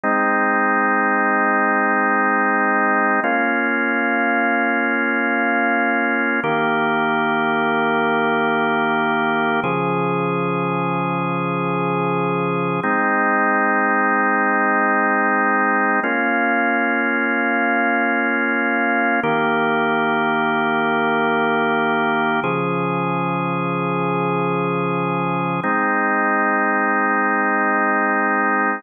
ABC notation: X:1
M:4/4
L:1/8
Q:1/4=75
K:Ab
V:1 name="Drawbar Organ"
[A,CE]8 | [B,DF]8 | [E,B,G]8 | [D,F,A]8 |
[A,CE]8 | [B,DF]8 | [E,B,G]8 | [D,F,A]8 |
[A,CE]8 |]